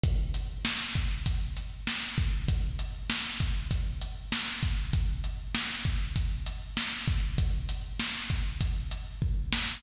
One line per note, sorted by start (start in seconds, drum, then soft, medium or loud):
0.04 kick loud
0.04 closed hi-hat loud
0.34 closed hi-hat medium
0.65 snare loud
0.95 kick medium
0.95 closed hi-hat medium
1.26 kick loud
1.26 closed hi-hat loud
1.57 closed hi-hat medium
1.87 snare loud
2.18 kick loud
2.18 closed hi-hat medium
2.48 kick loud
2.48 closed hi-hat loud
2.79 closed hi-hat medium
3.10 snare loud
3.40 kick medium
3.40 closed hi-hat medium
3.71 kick loud
3.71 closed hi-hat loud
4.02 closed hi-hat medium
4.32 snare loud
4.63 kick loud
4.63 closed hi-hat medium
4.93 kick loud
4.93 closed hi-hat loud
5.24 closed hi-hat medium
5.55 snare loud
5.85 kick medium
5.85 closed hi-hat medium
6.16 kick loud
6.16 closed hi-hat loud
6.46 closed hi-hat medium
6.77 snare loud
7.08 kick loud
7.08 closed hi-hat medium
7.38 kick loud
7.38 closed hi-hat loud
7.69 closed hi-hat medium
7.99 snare loud
8.30 kick medium
8.30 closed hi-hat medium
8.61 kick loud
8.61 closed hi-hat loud
8.91 closed hi-hat medium
9.22 kick loud
9.53 snare loud